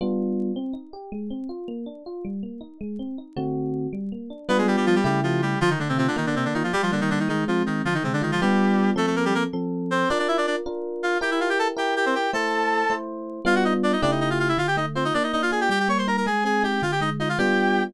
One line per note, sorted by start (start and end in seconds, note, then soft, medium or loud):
0.01 0.51 G3 medium
0.01 0.51 B3 medium
0.01 0.51 D4 medium
0.01 0.51 F4 medium
0.56 0.73 C4 medium
0.73 0.90 D#4 medium
0.93 1.10 G4 medium
1.12 1.29 G#3 medium
1.30 1.47 C4 medium
1.49 1.66 F4 medium
1.68 1.85 A#3 medium
1.86 2.03 D4 medium
2.06 2.23 F4 medium
2.25 2.41 G3 medium
2.43 2.60 A#3 medium
2.61 2.78 D#4 medium
2.81 2.98 G#3 medium
2.99 3.16 C4 medium
3.18 3.35 D#4 medium
3.37 3.87 D3 medium
3.37 3.87 A3 medium
3.37 3.87 C4 medium
3.37 3.87 F#4 medium
3.93 4.10 G3 medium
4.12 4.29 A#3 medium
4.30 4.47 D4 medium
4.49 4.99 G3 loud
4.49 4.57 B3 medium
4.49 4.99 B3 loud
4.49 4.99 D4 loud
4.49 4.99 F4 medium
4.49 4.57 B4 medium
4.58 4.67 G#3 medium
4.58 4.67 G#4 medium
4.67 4.76 G3 medium
4.67 4.76 G4 medium
4.77 4.86 G3 medium
4.77 4.86 G4 medium
4.86 4.95 F3 medium
4.86 4.95 F4 medium
4.95 5.04 G3 medium
4.95 5.04 G4 medium
5.04 5.55 C#3 loud
5.04 5.20 G3 medium
5.04 5.55 A3 medium
5.04 5.55 E4 medium
5.04 5.55 G4 medium
5.04 5.20 G4 medium
5.23 5.41 F3 medium
5.23 5.41 F4 medium
5.42 5.59 G3 medium
5.42 5.59 G4 medium
5.61 6.15 D3 loud
5.61 5.70 F3 medium
5.61 5.70 F4 medium
5.70 5.79 D#3 medium
5.70 5.79 D#4 medium
5.79 5.88 D3 medium
5.79 6.15 A3 medium
5.79 5.88 D4 medium
5.89 5.98 C3 medium
5.89 5.98 C4 medium
5.98 6.07 C3 medium
5.98 6.07 C4 medium
5.98 6.16 F4 medium
6.08 6.16 D3 medium
6.08 6.16 D4 medium
6.16 6.26 D#3 medium
6.16 6.70 A#3 loud
6.16 6.26 D#4 medium
6.26 6.35 D3 medium
6.26 6.35 D4 medium
6.35 6.44 C3 medium
6.35 6.44 C4 medium
6.35 6.70 D4 medium
6.45 6.54 D3 medium
6.45 6.54 D4 medium
6.54 6.63 D#3 medium
6.54 6.63 D#4 medium
6.54 6.73 F4 medium
6.64 6.72 F3 medium
6.64 6.72 F4 medium
6.73 6.82 G3 medium
6.73 7.27 G3 loud
6.73 6.82 G4 medium
6.82 6.91 F3 medium
6.82 6.91 F4 medium
6.92 7.00 D3 medium
6.92 7.27 A#3 medium
6.92 7.00 D4 medium
7.01 7.10 D#3 medium
7.01 7.10 D#4 medium
7.10 7.19 D3 medium
7.10 7.19 D4 medium
7.10 7.28 D#4 medium
7.20 7.28 D#3 medium
7.20 7.28 D#4 medium
7.29 7.44 D#3 medium
7.29 7.82 G#3 loud
7.29 7.44 D#4 medium
7.48 7.63 F3 medium
7.48 7.83 C4 medium
7.48 7.63 F4 medium
7.66 7.82 D#3 medium
7.66 7.82 D#4 medium
7.66 7.85 D#4 medium
7.85 8.39 D3 medium
7.85 7.94 F3 medium
7.85 7.94 F4 medium
7.94 8.03 D#3 medium
7.94 8.03 D#4 medium
8.04 8.13 C3 medium
8.04 8.39 G#3 medium
8.04 8.13 C4 medium
8.13 8.22 D3 medium
8.13 8.22 D4 medium
8.21 8.31 D#3 medium
8.21 8.31 D#4 medium
8.21 8.39 F4 medium
8.32 8.41 F3 medium
8.32 8.41 F4 medium
8.41 8.90 G3 medium
8.41 8.92 G3 loud
8.41 8.92 B3 loud
8.41 8.92 D4 loud
8.41 8.92 F4 medium
8.41 8.90 G4 medium
8.96 9.46 F3 medium
8.96 9.06 A3 medium
8.96 9.46 C4 medium
8.96 9.46 A4 medium
8.96 9.06 A4 medium
9.07 9.15 A3 medium
9.07 9.15 A4 medium
9.16 9.25 A#3 medium
9.16 9.25 A#4 medium
9.25 9.34 G3 medium
9.25 9.34 G4 medium
9.35 9.43 A#3 medium
9.35 9.43 A#4 medium
9.53 10.04 F3 medium
9.53 10.04 C4 medium
9.53 10.04 A4 medium
9.91 10.09 C4 medium
9.91 10.09 C5 medium
10.09 10.18 D4 medium
10.09 10.61 D4 medium
10.09 10.61 F4 medium
10.09 10.61 A#4 medium
10.09 10.18 D5 medium
10.19 10.28 D4 medium
10.19 10.28 D5 medium
10.28 10.37 E4 medium
10.28 10.37 E5 medium
10.37 10.46 D4 medium
10.37 10.46 D5 medium
10.47 10.56 D4 medium
10.47 10.56 D5 medium
10.66 11.16 D4 medium
10.66 11.16 F4 medium
10.66 11.16 A#4 medium
11.03 11.18 F4 medium
11.03 11.18 F5 medium
11.21 11.71 E4 medium
11.21 11.71 G4 medium
11.21 11.30 G4 medium
11.21 11.71 A#4 medium
11.21 11.30 G5 medium
11.31 11.40 E4 medium
11.31 11.40 E5 medium
11.40 11.49 F4 medium
11.40 11.49 F5 medium
11.49 11.58 G4 medium
11.49 11.58 G5 medium
11.59 11.68 A4 medium
11.59 11.68 A5 medium
11.77 12.27 E4 medium
11.77 12.27 G4 medium
11.77 11.95 G4 medium
11.77 12.27 A#4 medium
11.77 11.95 G5 medium
11.96 12.05 G4 medium
11.96 12.05 G5 medium
12.06 12.15 C4 medium
12.06 12.15 C5 medium
12.15 12.31 G4 medium
12.15 12.31 G5 medium
12.33 12.84 A3 medium
12.33 12.84 E4 medium
12.33 12.94 A4 medium
12.33 12.84 C5 medium
12.33 12.94 A5 medium
12.90 13.40 A3 medium
12.90 13.40 E4 medium
12.90 13.40 C5 medium
13.45 13.95 G3 medium
13.45 13.95 B3 loud
13.45 13.95 D4 medium
13.45 13.95 F4 loud
13.45 13.55 F4 medium
13.45 13.55 F5 medium
13.55 13.64 F#4 medium
13.55 13.64 F#5 medium
13.65 13.73 D#4 medium
13.65 13.73 D#5 medium
13.83 13.92 D4 medium
13.83 13.92 D5 medium
13.93 14.01 D#4 medium
13.93 14.01 D#5 medium
14.02 14.53 C#3 medium
14.02 14.53 A3 loud
14.02 14.11 D4 medium
14.02 14.53 E4 loud
14.02 14.53 G4 medium
14.02 14.11 D5 medium
14.11 14.20 D#4 soft
14.11 14.20 D#5 medium
14.21 14.29 D#4 medium
14.21 14.29 D#5 medium
14.30 14.39 F4 medium
14.30 14.39 F5 medium
14.39 14.48 F4 medium
14.39 14.48 F5 medium
14.49 14.57 E4 medium
14.49 14.57 E5 medium
14.57 15.11 D3 medium
14.57 14.67 F4 medium
14.57 14.67 F5 medium
14.67 14.76 G4 medium
14.67 14.76 G5 medium
14.77 15.12 A3 medium
14.77 14.86 D#4 medium
14.77 14.86 D#5 medium
14.95 15.04 C4 soft
14.95 15.13 F4 medium
14.95 15.04 C5 medium
15.05 15.14 D#4 medium
15.05 15.14 D#5 medium
15.14 15.68 A#3 medium
15.14 15.23 D4 medium
15.14 15.23 D5 medium
15.23 15.32 D#4 medium
15.23 15.32 D#5 medium
15.33 15.69 D4 medium
15.33 15.42 D#4 medium
15.33 15.42 D#5 medium
15.42 15.51 F4 medium
15.42 15.51 F5 medium
15.51 15.69 F4 medium
15.51 15.60 G#4 medium
15.51 15.60 G#5 medium
15.61 15.70 G4 medium
15.61 15.70 G5 medium
15.69 16.23 G3 loud
15.69 15.79 G4 medium
15.69 15.79 G5 medium
15.79 15.88 G4 medium
15.79 15.88 G5 medium
15.88 16.24 A#3 medium
15.88 15.98 C#5 medium
15.88 15.98 C#6 medium
15.98 16.07 C5 soft
15.98 16.07 C6 medium
16.07 16.25 D#4 medium
16.07 16.16 A#4 medium
16.07 16.16 A#5 medium
16.17 16.26 A#4 medium
16.17 16.26 A#5 medium
16.26 16.79 G#3 loud
16.26 16.44 G#4 medium
16.26 16.44 G#5 medium
16.44 16.80 C4 medium
16.44 16.63 G#4 medium
16.44 16.63 G#5 medium
16.63 16.81 D#4 medium
16.63 16.82 G4 medium
16.63 16.82 G5 medium
16.82 17.36 D3 loud
16.82 16.91 F4 medium
16.82 16.91 F5 medium
16.92 17.01 G4 medium
16.92 17.01 G5 medium
17.01 17.36 G#3 medium
17.01 17.10 D#4 medium
17.01 17.10 D#5 medium
17.20 17.29 D#4 medium
17.20 17.37 F4 medium
17.20 17.29 D#5 medium
17.29 17.38 F4 medium
17.29 17.38 F5 medium
17.38 17.89 G3 medium
17.38 17.89 B3 medium
17.38 17.89 D4 loud
17.38 17.89 F4 loud
17.38 17.84 G4 medium
17.38 17.84 G5 medium